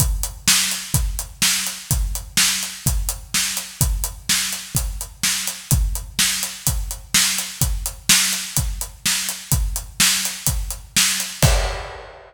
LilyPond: \new DrumStaff \drummode { \time 4/4 \tempo 4 = 126 <hh bd>8 hh8 sn8 hh8 <hh bd>8 hh8 sn8 hh8 | <hh bd>8 hh8 sn8 hh8 <hh bd>8 hh8 sn8 hh8 | <hh bd>8 hh8 sn8 hh8 <hh bd>8 hh8 sn8 hh8 | <hh bd>8 hh8 sn8 hh8 <hh bd>8 hh8 sn8 hh8 |
<hh bd>8 hh8 sn8 hh8 <hh bd>8 hh8 sn8 hh8 | <hh bd>8 hh8 sn8 hh8 <hh bd>8 hh8 sn8 hh8 | <cymc bd>4 r4 r4 r4 | }